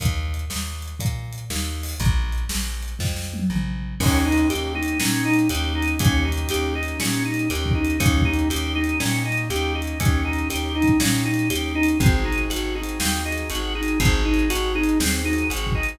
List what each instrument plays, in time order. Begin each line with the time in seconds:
0.00 electric bass (finger) D#2, kick, closed hi-hat
0.34 closed hi-hat
0.50 electric bass (finger) D#2, snare
0.82 closed hi-hat
0.99 electric bass (finger) A#2, kick, closed hi-hat
1.32 closed hi-hat
1.50 electric bass (finger) D#2, snare
1.83 open hi-hat
2.00 electric bass (finger) A#1, kick, closed hi-hat
2.32 closed hi-hat
2.49 electric bass (finger) A#1, snare
2.83 closed hi-hat
2.99 electric bass (finger) F2, kick, snare
3.16 snare
3.34 high tom
3.50 electric bass (finger) A#1, mid tom
4.00 electric bass (finger) D#2, acoustic grand piano A#3 C#4 D#4 G4, drawbar organ C#4, kick, crash
4.24 acoustic grand piano A#3 C#4 D#4 G4, drawbar organ D#4
4.32 closed hi-hat
4.50 electric bass (finger) D#2, acoustic grand piano A#3 C#4 D#4 G4, drawbar organ G4, closed hi-hat
4.75 acoustic grand piano A#3 C#4 D#4 G4, drawbar organ D#4
4.83 closed hi-hat
5.00 electric bass (finger) A#2, acoustic grand piano A#3 C#4 D#4 G4, drawbar organ C#4, snare
5.25 drawbar organ D#4
5.34 closed hi-hat
5.49 electric bass (finger) D#2, acoustic grand piano A#3 C#4 D#4 G4, drawbar organ G4, closed hi-hat
5.75 drawbar organ D#4
5.82 closed hi-hat
5.99 electric bass (finger) D#2, acoustic grand piano A#3 C#4 D#4 G4, drawbar organ C#4, kick, closed hi-hat
6.25 acoustic grand piano A#3 C#4 D#4 G4, drawbar organ D#4
6.32 closed hi-hat
6.49 electric bass (finger) D#2, acoustic grand piano A#3 C#4 D#4 G4, drawbar organ G4, closed hi-hat
6.75 acoustic grand piano A#3 C#4 D#4 G4, drawbar organ D#4
6.83 closed hi-hat
7.00 electric bass (finger) A#2, acoustic grand piano A#3 C#4 D#4 G4, drawbar organ C#4, snare
7.25 drawbar organ D#4
7.34 closed hi-hat
7.50 electric bass (finger) D#2, acoustic grand piano A#3 C#4 D#4 G4, drawbar organ G4, closed hi-hat
7.66 kick
7.75 drawbar organ D#4
7.85 closed hi-hat
8.00 electric bass (finger) D#2, acoustic grand piano A#3 C#4 D#4 G4, drawbar organ C#4, kick, closed hi-hat
8.17 kick
8.25 acoustic grand piano A#3 C#4 D#4 G4, drawbar organ D#4
8.33 closed hi-hat
8.50 electric bass (finger) D#2, acoustic grand piano A#3 C#4 D#4 G4, drawbar organ G4, closed hi-hat
8.75 acoustic grand piano A#3 C#4 D#4 G4, drawbar organ D#4
8.84 closed hi-hat
9.00 electric bass (finger) A#2, acoustic grand piano A#3 C#4 D#4 G4, drawbar organ C#4, snare
9.25 drawbar organ D#4
9.32 closed hi-hat
9.49 electric bass (finger) D#2, acoustic grand piano A#3 C#4 D#4 G4, drawbar organ G4, closed hi-hat
9.75 drawbar organ D#4
9.82 closed hi-hat
10.00 electric bass (finger) D#2, acoustic grand piano A#3 C#4 D#4 G4, drawbar organ C#4, kick, closed hi-hat
10.25 acoustic grand piano A#3 C#4 D#4 G4, drawbar organ D#4
10.33 closed hi-hat
10.50 electric bass (finger) D#2, acoustic grand piano A#3 C#4 D#4 G4, drawbar organ G4, closed hi-hat
10.75 acoustic grand piano A#3 C#4 D#4 G4, drawbar organ D#4
10.82 kick, closed hi-hat
11.00 electric bass (finger) A#2, acoustic grand piano A#3 C#4 D#4 G4, drawbar organ C#4, snare
11.25 drawbar organ D#4
11.34 closed hi-hat
11.50 electric bass (finger) D#2, acoustic grand piano A#3 C#4 D#4 G4, drawbar organ G4, closed hi-hat
11.75 drawbar organ D#4
11.83 closed hi-hat
12.00 electric bass (finger) G#1, acoustic grand piano C4 D#4 F#4 G#4, drawbar organ C4, kick, closed hi-hat
12.25 drawbar organ D#4
12.32 closed hi-hat
12.50 electric bass (finger) G#1, drawbar organ F#4, closed hi-hat
12.75 acoustic grand piano C4 D#4 F#4 G#4, drawbar organ D#4
12.83 closed hi-hat
13.00 electric bass (finger) D#2, drawbar organ C4, snare
13.25 acoustic grand piano C4 D#4 F#4 G#4, drawbar organ D#4
13.32 closed hi-hat
13.50 electric bass (finger) G#1, acoustic grand piano C4 D#4 F#4 G#4, drawbar organ F#4, closed hi-hat
13.75 acoustic grand piano C4 D#4 F#4 G#4, drawbar organ D#4
13.83 closed hi-hat
14.00 electric bass (finger) G#1, drawbar organ C4, acoustic grand piano C4 D#4 F#4 G#4, kick, closed hi-hat
14.25 drawbar organ D#4
14.34 closed hi-hat
14.50 electric bass (finger) G#1, drawbar organ F#4, closed hi-hat
14.75 acoustic grand piano C4 D#4 F#4 G#4, drawbar organ D#4
14.83 closed hi-hat
15.00 electric bass (finger) D#2, drawbar organ C4, snare
15.24 acoustic grand piano C4 D#4 F#4 G#4, drawbar organ D#4
15.33 closed hi-hat
15.50 electric bass (finger) G#1, acoustic grand piano C4 D#4 F#4 G#4, drawbar organ F#4, closed hi-hat
15.67 kick
15.75 acoustic grand piano C4 D#4 F#4 G#4, drawbar organ D#4
15.83 closed hi-hat